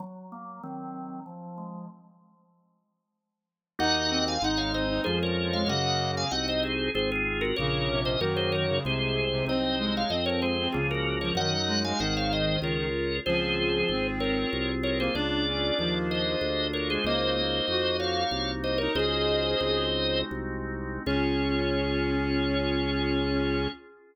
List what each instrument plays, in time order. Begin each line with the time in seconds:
0.00 drawbar organ F#3
0.32 drawbar organ A#3
0.63 drawbar organ D#3 F#3 C4
1.26 drawbar organ F3
1.58 drawbar organ G#3
3.79 drawbar organ D#2 A#3 D#4 F#4 D#5 F#5, clarinet D#4
4.10 clarinet C4
4.28 drawbar organ F5 G#5
4.42 drawbar organ G#1 G#3 D#5 F#5, clarinet D#4
4.57 drawbar organ C#5 F5
4.74 drawbar organ C4 C5 D#5
4.90 clarinet D#4
5.04 drawbar organ F2 G#3 C#4 F4 G#4 C5, clarinet F3
5.23 drawbar organ A#4 C#5
5.53 clarinet G#3, drawbar organ C#5 F5
5.67 drawbar organ F#2 A#3 C#4 F#4 D#5 F#5, clarinet C#3
6.17 drawbar organ F5 G#5
6.31 drawbar organ C2 C4 D#4 F#4 D#5 F#5
6.48 drawbar organ C5 D#5
6.63 drawbar organ G#4 C5
6.94 drawbar organ G#1 C4 F4 G#4 C5
7.12 drawbar organ F4 G#4
7.41 drawbar organ F#4 A#4
7.56 drawbar organ A#1 A#3 A#4 C#5, clarinet C#3
7.89 clarinet C3, drawbar organ C#4
8.05 drawbar organ C5 D#5
8.20 drawbar organ F#2 A#3 D#4 F#4 A#4 C#5, clarinet D#3
8.37 drawbar organ G#4 C5
8.52 drawbar organ A#4 C#5
8.68 clarinet C#3
8.84 drawbar organ C2 G#3 G#4 C5, clarinet C3
9.16 drawbar organ C4
9.31 clarinet C3
9.46 drawbar organ C2 F#3 C4 D#4 C5 D#5, clarinet C4
9.79 clarinet G#3
9.97 drawbar organ C#5 F5
10.10 drawbar organ F2 F3 C5 D#5, clarinet C4
10.26 drawbar organ A#4 C#5
10.42 drawbar organ G#3 G#4 C5
10.60 clarinet C4
10.72 drawbar organ C#2 F3 A#3 C#4 F4 G#4, clarinet C#3
10.91 drawbar organ F#4 A#4
11.21 clarinet F3, drawbar organ A#4 C#5
11.35 drawbar organ F#2 D#4 D#5 F#5, clarinet D#3
11.54 clarinet F#3
11.67 clarinet G#3, drawbar organ F#4
11.84 clarinet G#3, drawbar organ F5 G#5
11.99 drawbar organ G#1 D#4 G#4 C5 D#5 F#5, clarinet D#3
12.17 drawbar organ C#5 F5
12.33 drawbar organ C5 D#5
12.62 drawbar organ C#2 F4 G#4 A#4 C#5
13.26 drawbar organ C#2 C4 F4 G#4 C5, clarinet F3
13.59 clarinet F3
13.89 drawbar organ G#1, clarinet C4
14.20 drawbar organ A#4 C#5
14.53 drawbar organ C2
14.83 drawbar organ A#4 C#5
14.99 clarinet A#3, drawbar organ G#4 C5
15.15 drawbar organ C#2 A#3 D4 F4 G#4 D5, clarinet D4
15.47 clarinet C#4
15.79 drawbar organ D#2, clarinet F3
16.11 drawbar organ C5 D#5
16.41 drawbar organ D2
16.73 drawbar organ A#4 C#5
16.90 clarinet G#3, drawbar organ G#4 C5
17.04 drawbar organ C#2 A#3 D#4 F#4 C5 D#5, clarinet A#3
17.37 clarinet A#3
17.68 drawbar organ F2, clarinet F#4
18.00 drawbar organ C#5 F5
18.31 drawbar organ C2
18.64 drawbar organ C5 D#5
18.78 clarinet D#4, drawbar organ A#4 C#5
18.95 drawbar organ C#2 G#3 C#4 D#4 F#4 C5 D#5, clarinet G#4
19.60 drawbar organ C#2 G#3 C4 D#4 F#4
20.31 drawbar organ C2
21.06 drawbar organ C#2 C#4 F4 G#4 C#5, clarinet C#4